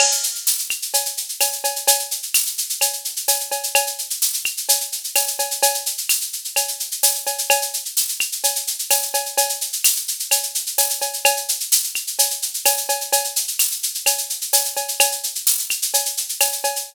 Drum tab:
CC |x---------------|----------------|----------------|----------------|
TB |----x-------x---|----x-------x---|----x-------x---|----x-------x---|
SH |-xxxxxxxxxxxxxxx|xxxxxxxxxxxxxxxx|xxxxxxxxxxxxxxxx|xxxxxxxxxxxxxxxx|
CB |x-------x---x-x-|x-------x---x-x-|x-------x---x-x-|x-------x---x-x-|
CL |x-----x-----x---|----x---x-------|x-----x-----x---|----x---x-------|

CC |----------------|----------------|----------------|----------------|
TB |----x-------x---|----x-------x---|----x-------x---|----x-------x---|
SH |xxxxxxxxxxxxxxxx|xxxxxxxxxxxxxxxx|xxxxxxxxxxxxxxxx|xxxxxxxxxxxxxxxx|
CB |x-------x---x-x-|x-------x---x-x-|x-------x---x-x-|x-------x---x-x-|
CL |x-----x-----x---|----x---x-------|x-----x-----x---|----x---x-------|

CC |----------------|
TB |----x-------x---|
SH |xxxxxxxxxxxxxxxx|
CB |x-------x---x-x-|
CL |x-----x-----x---|